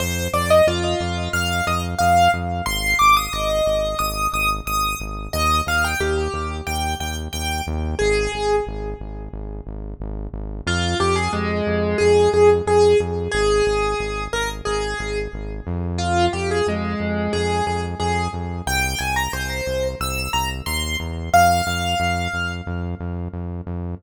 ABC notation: X:1
M:4/4
L:1/16
Q:1/4=90
K:Fdor
V:1 name="Acoustic Grand Piano"
c2 d e F4 f2 e z f2 z2 | c'2 d' e' e4 e'2 e' z e'2 z2 | e2 f g G4 g2 g z g2 z2 | A4 z12 |
F2 G A A,4 A2 A z A2 z2 | A6 B z A4 z4 | F2 G A A,4 A2 A z A2 z2 | g2 a b c4 =e'2 b z c'2 z2 |
f8 z8 |]
V:2 name="Synth Bass 1" clef=bass
F,,2 F,,2 F,,2 F,,2 F,,2 F,,2 F,,2 F,,2 | A,,,2 A,,,2 A,,,2 A,,,2 A,,,2 A,,,2 A,,,2 A,,,2 | E,,2 E,,2 E,,2 E,,2 E,,2 E,,2 E,,2 E,,2 | A,,,2 A,,,2 A,,,2 A,,,2 A,,,2 A,,,2 A,,,2 A,,,2 |
F,,2 F,,2 F,,2 F,,2 F,,2 F,,2 F,,2 F,,2 | A,,,2 A,,,2 A,,,2 A,,,2 A,,,2 A,,,2 A,,,2 F,,2- | F,,2 F,,2 F,,2 F,,2 F,,2 F,,2 F,,2 F,,2 | C,,2 C,,2 C,,2 C,,2 C,,2 C,,2 E,,2 =E,,2 |
F,,2 F,,2 F,,2 F,,2 F,,2 F,,2 F,,2 F,,2 |]